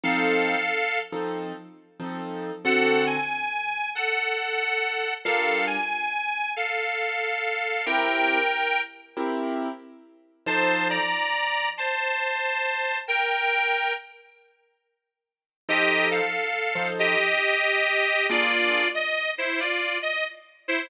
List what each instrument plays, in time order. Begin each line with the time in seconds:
0.03 acoustic grand piano F3 C4 D#4 A4, harmonica A4 F5
1.12 acoustic grand piano F3 C4 D#4 A4
2.00 acoustic grand piano F3 C4 D#4 A4
2.65 acoustic grand piano D3 C4 F#4 A4, harmonica A4 F#5
3.07 harmonica G#5
3.95 harmonica A4 F#5
5.25 acoustic grand piano G3 D4 F4 A#4, harmonica A4 F5
5.67 harmonica G#5
6.56 harmonica A4 F5
7.86 acoustic grand piano C4 E4 G4 A#4, harmonica A#4 G5
9.17 acoustic grand piano C4 E4 G4 A#4
10.46 acoustic grand piano F3 D#4 A4 C5, harmonica C5 A5
10.90 harmonica D5 A#5
11.78 harmonica C5 A5
13.08 harmonica A#4 G5
15.69 acoustic grand piano F3 D#4 A4 C5, harmonica G4 D#5
16.11 harmonica A4 F5
16.75 acoustic grand piano F3 D#4 A4 C5
16.99 harmonica G4 D#5
18.29 acoustic grand piano A#3 D4 F4 G#4, harmonica F4 D5
18.95 harmonica D#5
19.38 harmonica E4 C5
19.60 harmonica F4 D5
20.02 harmonica D#5
20.68 harmonica E4 C5